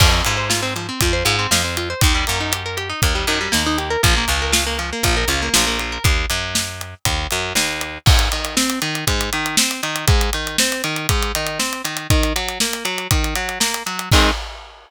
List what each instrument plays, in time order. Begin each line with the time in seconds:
0.00 electric bass (finger) F2, overdriven guitar F3, kick, crash
0.12 overdriven guitar C4
0.24 electric bass (finger) G#2, overdriven guitar F4, closed hi-hat
0.37 overdriven guitar C5
0.50 overdriven guitar F4, snare
0.63 overdriven guitar C4
0.76 overdriven guitar F3, closed hi-hat
0.89 overdriven guitar C4
1.01 electric bass (finger) F2, overdriven guitar F4, kick, closed hi-hat
1.13 overdriven guitar C5
1.25 electric bass (finger) G#2, overdriven guitar F4, closed hi-hat
1.39 overdriven guitar C4
1.51 electric bass (finger) F2, overdriven guitar F3, snare
1.64 overdriven guitar C4
1.77 overdriven guitar F4, closed hi-hat
1.90 overdriven guitar C5
2.01 electric bass (finger) D#2, overdriven guitar D#3, kick, closed hi-hat
2.15 overdriven guitar G3
2.27 electric bass (finger) F#2, overdriven guitar A#3, closed hi-hat
2.40 overdriven guitar D#4
2.52 overdriven guitar G4, closed hi-hat
2.66 overdriven guitar A#4
2.77 overdriven guitar G4, closed hi-hat
2.89 overdriven guitar D#4
3.02 electric bass (finger) D#2, overdriven guitar A#3, kick, closed hi-hat
3.15 overdriven guitar G3
3.27 electric bass (finger) F#2, overdriven guitar D#3, closed hi-hat
3.41 overdriven guitar G3
3.52 electric bass (finger) D#2, overdriven guitar A#3, snare
3.66 overdriven guitar D#4
3.78 overdriven guitar G4, closed hi-hat
3.90 overdriven guitar A#4
4.03 electric bass (finger) A#1, overdriven guitar F3, kick, closed hi-hat
4.17 overdriven guitar A#3
4.28 electric bass (finger) C#2, overdriven guitar F4, closed hi-hat
4.42 overdriven guitar A#4
4.52 overdriven guitar F4, snare
4.67 overdriven guitar A#3
4.79 overdriven guitar F3, closed hi-hat
4.93 overdriven guitar A#3
5.03 electric bass (finger) A#1, overdriven guitar F4, kick, closed hi-hat
5.17 overdriven guitar A#4
5.28 electric bass (finger) C#2, overdriven guitar F4, closed hi-hat
5.42 overdriven guitar A#3
5.54 electric bass (finger) A#1, overdriven guitar F3, snare
5.67 overdriven guitar A#3
5.79 overdriven guitar F4, closed hi-hat
5.92 overdriven guitar A#4
6.04 electric bass (finger) D#2, kick, closed hi-hat
6.30 electric bass (finger) F#2, closed hi-hat
6.55 snare
6.81 closed hi-hat
7.05 electric bass (finger) D#2, kick, closed hi-hat
7.31 electric bass (finger) F#2, closed hi-hat
7.55 electric bass (finger) D#2, snare
7.81 closed hi-hat
8.06 overdriven guitar G#2, kick, crash
8.19 closed hi-hat
8.32 overdriven guitar D#3, closed hi-hat
8.45 closed hi-hat
8.57 overdriven guitar C4, snare
8.70 closed hi-hat
8.82 overdriven guitar D#3, closed hi-hat
8.95 closed hi-hat
9.07 overdriven guitar G#2, kick, closed hi-hat
9.21 closed hi-hat
9.33 overdriven guitar D#3, closed hi-hat
9.46 closed hi-hat
9.57 overdriven guitar C4, snare
9.71 closed hi-hat
9.83 overdriven guitar D#3, closed hi-hat
9.96 closed hi-hat
10.07 overdriven guitar G#2, kick, closed hi-hat
10.21 closed hi-hat
10.33 overdriven guitar D#3, closed hi-hat
10.47 closed hi-hat
10.58 overdriven guitar C4, snare
10.72 closed hi-hat
10.84 overdriven guitar D#3, closed hi-hat
10.96 closed hi-hat
11.09 overdriven guitar G#2, kick, closed hi-hat
11.22 closed hi-hat
11.35 overdriven guitar D#3, closed hi-hat
11.47 closed hi-hat
11.59 overdriven guitar C4, snare
11.73 closed hi-hat
11.84 overdriven guitar D#3, closed hi-hat
11.97 closed hi-hat
12.10 overdriven guitar D#3, kick, closed hi-hat
12.23 closed hi-hat
12.36 overdriven guitar F#3, closed hi-hat
12.48 closed hi-hat
12.60 overdriven guitar A#3, snare
12.73 closed hi-hat
12.85 overdriven guitar F#3, closed hi-hat
12.98 closed hi-hat
13.11 overdriven guitar D#3, kick, closed hi-hat
13.24 closed hi-hat
13.35 overdriven guitar F#3, closed hi-hat
13.49 closed hi-hat
13.60 overdriven guitar A#3, snare
13.74 closed hi-hat
13.86 overdriven guitar F#3, closed hi-hat
13.99 closed hi-hat
14.12 overdriven guitar D#3 G#3 C4, kick, crash